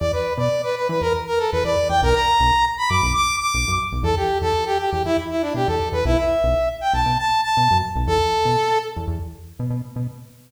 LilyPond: <<
  \new Staff \with { instrumentName = "Brass Section" } { \time 4/4 \key e \dorian \tempo 4 = 119 d''16 b'8 d''8 b'16 b'16 b'16 ais'16 r16 bes'16 a'16 b'16 d''8 g''16 | ais'16 ais''4~ ais''16 b''16 d'''8 d'''8 d'''8. r8 | a'16 g'8 a'8 g'16 g'16 g'16 e'16 r16 e'16 d'16 g'16 a'8 b'16 | e'16 e''4~ e''16 g''16 a''8 a''8 a''8. r8 |
a'4. r2 r8 | }
  \new Staff \with { instrumentName = "Synth Bass 1" } { \clef bass \time 4/4 \key e \dorian e,8. b,4 e16 e,4 e,16 e,8 e,16 | b,,8. b,,4 fis,16 b,,4 b,,16 fis,8 b,,16 | e,8. e,4 e,16 e,4 b,16 e,8 e,16 | b,,8. b,,4 b,,16 b,4 b,16 fis,8 b,,16 |
e,8. b,4 e,16 e,4 b,16 b,8 b,16 | }
>>